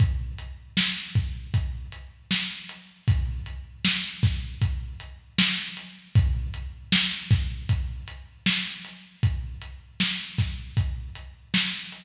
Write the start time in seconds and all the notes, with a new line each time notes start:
0.00 kick, closed hi-hat
0.38 closed hi-hat
0.77 snare
1.15 kick, closed hi-hat
1.54 kick, closed hi-hat
1.92 closed hi-hat
2.31 snare
2.69 closed hi-hat
3.08 kick, closed hi-hat
3.46 closed hi-hat
3.85 snare
4.23 kick, snare, closed hi-hat
4.62 kick, closed hi-hat
5.00 closed hi-hat
5.38 snare
5.77 closed hi-hat
6.15 kick, closed hi-hat
6.54 closed hi-hat
6.92 snare
7.31 kick, snare, closed hi-hat
7.69 kick, closed hi-hat
8.08 closed hi-hat
8.46 snare
8.85 closed hi-hat
9.23 kick, closed hi-hat
9.62 closed hi-hat
10.00 snare
10.38 kick, snare, closed hi-hat
10.77 kick, closed hi-hat
11.15 closed hi-hat
11.54 snare
11.92 closed hi-hat